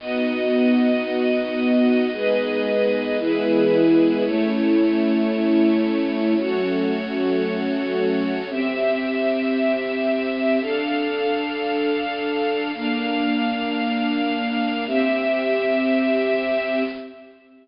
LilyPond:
<<
  \new Staff \with { instrumentName = "String Ensemble 1" } { \time 4/4 \key b \mixolydian \tempo 4 = 113 <b dis' fis'>1 | <gis b dis'>2 <e gis b>2 | <a cis' e'>1 | <fis a cis'>1 |
\key c \mixolydian r1 | r1 | r1 | r1 | }
  \new Staff \with { instrumentName = "String Ensemble 1" } { \time 4/4 \key b \mixolydian <b fis' dis''>1 | <gis' b' dis''>2 <e' gis' b'>2 | <a e' cis''>1 | <fis' a' cis''>1 |
\key c \mixolydian <c' g' e''>1 | <d' a' f''>1 | <bes d' f''>1 | <c' g' e''>1 | }
>>